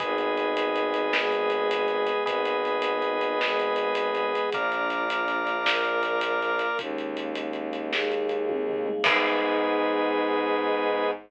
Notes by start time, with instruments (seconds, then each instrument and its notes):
0.00 violin G#1, choir aahs B3 D#4 G#4, drawbar organ G#4 B4 D#5, kick, closed hi-hat
0.18 closed hi-hat
0.37 closed hi-hat
0.57 closed hi-hat
0.76 closed hi-hat
0.94 closed hi-hat
1.13 choir aahs G#3 B3 G#4, snare
1.32 closed hi-hat
1.50 closed hi-hat
1.71 closed hi-hat
1.88 closed hi-hat
2.07 closed hi-hat
2.25 violin G#1, choir aahs B3 D#4 G#4, drawbar organ G#4 B4 D#5, kick, closed hi-hat
2.45 closed hi-hat
2.65 closed hi-hat
2.82 closed hi-hat
3.02 closed hi-hat
3.21 closed hi-hat
3.41 choir aahs G#3 B3 G#4, snare
3.59 closed hi-hat
3.76 closed hi-hat
3.95 closed hi-hat
4.15 closed hi-hat
4.35 closed hi-hat
4.52 violin A#1, choir aahs A#3 D4 F4, drawbar organ A#4 D5 F5, kick, closed hi-hat
4.72 closed hi-hat
4.90 closed hi-hat
5.10 closed hi-hat
5.28 closed hi-hat
5.47 closed hi-hat
5.65 choir aahs A#3 F4 A#4, snare
5.85 closed hi-hat
6.03 closed hi-hat
6.21 closed hi-hat
6.42 closed hi-hat
6.59 closed hi-hat
6.79 violin D#2, choir aahs G#3 A#3 C#4 D#4, kick, closed hi-hat
6.98 closed hi-hat
7.17 closed hi-hat
7.35 closed hi-hat
7.53 closed hi-hat
7.73 closed hi-hat
7.91 choir aahs G#3 A#3 D#4 G#4, snare
8.12 closed hi-hat
8.29 closed hi-hat
8.49 kick, high tom
8.69 floor tom
8.86 mid tom
9.04 violin G#2, choir aahs B3 D#4 G#4, drawbar organ G#4 B4 D#5, kick, crash